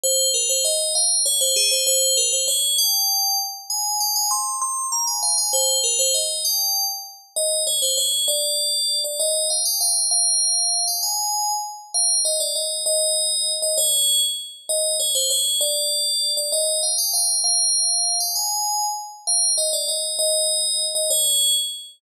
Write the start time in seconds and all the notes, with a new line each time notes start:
0.03 C5
0.34 A#4
0.49 C5
0.65 D#5
0.95 F5
1.26 C#5
1.41 C5
1.56 G#4
1.71 C5
1.87 C5
2.17 A#4
2.33 C5
2.48 C#5
2.78 G5
3.70 G#5
4.00 G5
4.16 G#5
4.31 C6
4.62 C6
4.92 A#5
5.07 G#5
5.23 F5
5.38 G#5
5.53 C5
5.84 A#4
5.99 C5
6.14 D#5
6.45 G5
7.36 D#5
7.67 C#5
7.82 C5
7.97 C#5
8.28 D5
9.04 D5
9.20 D#5
9.50 F5
9.65 G5
9.81 F5
10.11 F5
10.87 G5
11.03 G#5
11.94 F5
12.25 D#5
12.40 D5
12.55 D#5
12.86 D#5
13.62 D#5
13.78 C#5
14.69 D#5
15.00 C#5
15.15 C5
15.30 C#5
15.61 D5
16.37 D5
16.52 D#5
16.83 F5
16.98 G5
17.13 F5
17.44 F5
18.20 G5
18.36 G#5
19.27 F5
19.58 D#5
19.73 D5
19.88 D#5
20.19 D#5
20.95 D#5
21.10 C#5